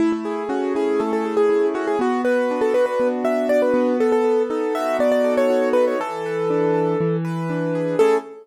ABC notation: X:1
M:4/4
L:1/16
Q:1/4=120
K:A
V:1 name="Acoustic Grand Piano"
E E3 F2 G2 A A2 G3 F G | F2 B3 A B B2 z e2 d B3 | A A3 A2 e2 d d2 c3 B c | A10 z6 |
A4 z12 |]
V:2 name="Acoustic Grand Piano"
A,2 G2 C2 E2 A,2 G2 E2 C2 | B,2 F2 D2 F2 B,2 F2 F2 B,2- | B,2 A2 ^D2 F2 B,2 A2 F2 D2 | E,2 B2 D2 A2 E,2 B2 D2 G2 |
[A,CEG]4 z12 |]